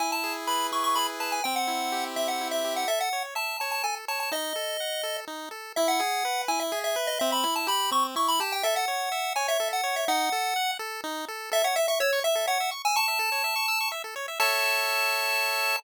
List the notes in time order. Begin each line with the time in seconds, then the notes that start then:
0.00 E4 G#5
0.12 A5
0.24 G#4
0.47 B4 B5
0.72 E4 C#6
0.84 C#6
0.95 G#4 B5
1.20 B4 A5
1.32 G#5
1.44 C4 G5
1.56 F#5
1.68 E4
1.92 G4
2.16 C4 E5
2.28 F#5
2.41 E4
2.51 E5
2.65 G4
2.76 F#5
2.88 A4 E5
3.00 F#5
3.13 C#5
3.35 E5 A5
3.60 C#5 A5
3.71 A5
3.83 A4 G#5
4.08 C#5 A5
4.20 A5
4.32 D#4 D#5
4.56 A4
4.80 F#5
5.03 A4
5.28 D#4
5.51 A4
5.76 E4 E5
5.88 F#5
6.00 G#4
6.25 B4
6.48 E4 G#5
6.60 E5
6.72 G#4
6.84 E5
6.96 B4
7.07 D#5
7.19 C4 E5
7.32 B5
7.44 E4
7.56 A5
7.67 G4 B5
7.91 C4 C#6
8.16 E4 C#6
8.28 B5
8.40 G4 A5
8.52 G5
8.63 A4 E5
8.76 F#5
8.88 C#5
9.12 E5
9.36 C#5 G#5
9.48 E5
9.60 A4
9.73 F#5
9.84 C#5
9.96 E5
10.08 D#4 F#5
10.32 A4
10.56 F#5
10.79 A4
11.04 D#4
11.28 A4
11.52 A4 E5
11.64 C#5 F#5
11.76 E5
11.88 E5 C#6
12.00 C#5 E6
12.13 C#6
12.24 E5
12.35 A4
12.47 C#5 F#5
12.60 E5
12.71 C#6
12.85 G#5 E6
12.96 A5 C#6
13.08 E5
13.19 A4
13.32 C#5
13.44 E5
13.56 C#6
13.68 E6
13.80 C#6
13.92 E5
14.04 A4
14.16 C#5
14.28 E5
14.40 A4 C#5 E5 A5